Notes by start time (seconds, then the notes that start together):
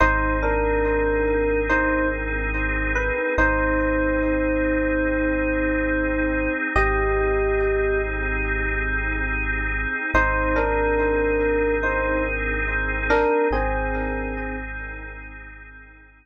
0.00 G#1 C4 D#4 G#4 C5
0.43 D4 A#4
1.69 D#4 C5
2.95 B4
3.38 G#1 C4 D#4 G#4 C5
6.76 G#1 C4 D#4 G4 G#4 D#5
10.14 G#1 C4 D#4 G#4 C5
10.56 D4 A#4
11.83 D#4 C5
13.10 D4 A#4
13.51 G#1 C4 D#4 G#4